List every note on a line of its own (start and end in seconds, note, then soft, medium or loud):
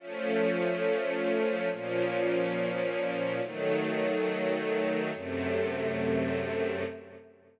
0.00 1.69 F3 loud
0.00 1.69 A3 loud
0.00 1.69 C#4 loud
1.71 3.41 A#2 loud
1.71 3.41 F3 loud
1.71 3.41 C#4 loud
3.42 5.11 D#3 loud
3.42 5.11 F#3 loud
3.42 5.11 A3 loud
5.14 6.84 F#2 medium
5.14 6.84 C3 medium
5.14 6.84 A3 loud